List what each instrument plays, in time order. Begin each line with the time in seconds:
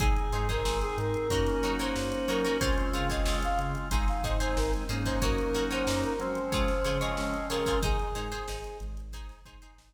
0.00 synth bass 1 G#1, drawbar organ C4 D#4 G#4, acoustic guitar (steel) D#4 G#4 C5, brass section G#4, kick, closed hi-hat
0.16 closed hi-hat
0.32 synth bass 1 G#2, acoustic guitar (steel) D#4 G#4 C5, closed hi-hat
0.49 acoustic guitar (steel) D#4 G#4 C5, brass section A#4, kick, snare, closed hi-hat
0.65 synth bass 1 G#1, acoustic guitar (steel) D#4 G#4 C5, snare
0.81 brass section G#4, closed hi-hat
0.98 synth bass 1 G#2, brass section A#4, closed hi-hat
1.14 closed hi-hat
1.30 synth bass 1 F#2, drawbar organ A#3 C#4 D#4 F#4, acoustic guitar (steel) D#4 F#4 A#4 C#5, kick, closed hi-hat
1.46 snare, closed hi-hat
1.63 synth bass 1 F#3, acoustic guitar (steel) D#4 F#4 A#4 C#5, closed hi-hat
1.79 acoustic guitar (steel) D#4 F#4 A#4 C#5, brass section C5, closed hi-hat
1.96 synth bass 1 F#2, snare
2.12 closed hi-hat
2.28 synth bass 1 F#3, acoustic guitar (steel) D#4 F#4 A#4 C#5, brass section A#4, closed hi-hat
2.44 acoustic guitar (steel) D#4 F#4 A#4 C#5, closed hi-hat
2.59 synth bass 1 C#2, drawbar organ G#3 C4 C#4 F4, acoustic guitar (steel) F4 G#4 C5 C#5, brass section C5, kick, closed hi-hat
2.76 brass section C5, closed hi-hat
2.93 synth bass 1 C#3, acoustic guitar (steel) F4 G#4 C5 C#5, brass section F5, snare, closed hi-hat
3.09 acoustic guitar (steel) F4 G#4 C5 C#5, brass section D#5, kick, closed hi-hat
3.26 synth bass 1 C#2, acoustic guitar (steel) F4 G#4 C5 C#5, snare
3.42 brass section F5, closed hi-hat
3.59 synth bass 1 C#3, closed hi-hat
3.75 closed hi-hat
3.91 synth bass 1 G#1, drawbar organ G#3 C4 D#4, acoustic guitar (steel) D#4 G#4 C5, kick, closed hi-hat
4.08 brass section F5, snare, closed hi-hat
4.23 synth bass 1 G#2, acoustic guitar (steel) D#4 G#4 C5, brass section D#5, kick, closed hi-hat
4.40 acoustic guitar (steel) D#4 G#4 C5, brass section C5, closed hi-hat
4.56 synth bass 1 G#1, brass section A#4, snare
4.73 closed hi-hat
4.89 synth bass 1 G#2, drawbar organ F#3 A#3 C#4 D#4, acoustic guitar (steel) D#4 G#4 C5, closed hi-hat
5.05 acoustic guitar (steel) D#4 G#4 C5, brass section C5, kick, snare, closed hi-hat
5.22 synth bass 1 F#2, acoustic guitar (steel) D#4 F#4 A#4 C#5, brass section A#4, kick, closed hi-hat
5.38 closed hi-hat
5.54 synth bass 1 F#3, acoustic guitar (steel) D#4 F#4 A#4 C#5, snare, closed hi-hat
5.71 acoustic guitar (steel) D#4 F#4 A#4 C#5, brass section C5, closed hi-hat
5.87 synth bass 1 F#2, acoustic guitar (steel) D#4 F#4 A#4 C#5, snare
6.04 brass section A#4, closed hi-hat
6.19 drawbar organ F3 G#3 C4 C#4, synth bass 1 F#3, brass section C5, closed hi-hat
6.35 closed hi-hat
6.52 synth bass 1 C#2, acoustic guitar (steel) F4 G#4 C5 C#5, kick, closed hi-hat
6.68 snare, closed hi-hat
6.85 synth bass 1 C#3, acoustic guitar (steel) F4 G#4 C5 C#5, closed hi-hat
7.00 acoustic guitar (steel) F4 G#4 C5 C#5, brass section D#5, closed hi-hat
7.17 synth bass 1 C#2, snare
7.34 closed hi-hat
7.49 synth bass 1 C#3, acoustic guitar (steel) F4 G#4 C5 C#5, brass section A#4, closed hi-hat
7.66 acoustic guitar (steel) F4 G#4 C5 C#5, kick, closed hi-hat
7.82 synth bass 1 G#1, acoustic guitar (steel) D#4 G#4 C5, brass section G#4, kick, closed hi-hat
7.99 closed hi-hat
8.15 synth bass 1 G#2, acoustic guitar (steel) D#4 G#4 C5, closed hi-hat
8.32 acoustic guitar (steel) D#4 G#4 C5, closed hi-hat
8.48 synth bass 1 G#1, acoustic guitar (steel) D#4 G#4 C5, snare
8.64 snare, closed hi-hat
8.80 synth bass 1 G#1, closed hi-hat
8.97 snare, closed hi-hat
9.13 acoustic guitar (steel) D#4 G#4 C5, kick, closed hi-hat
9.29 snare, closed hi-hat
9.45 synth bass 1 G#2, acoustic guitar (steel) D#4 G#4 C5, kick, closed hi-hat
9.62 acoustic guitar (steel) D#4 G#4 C5, closed hi-hat
9.78 synth bass 1 G#1, snare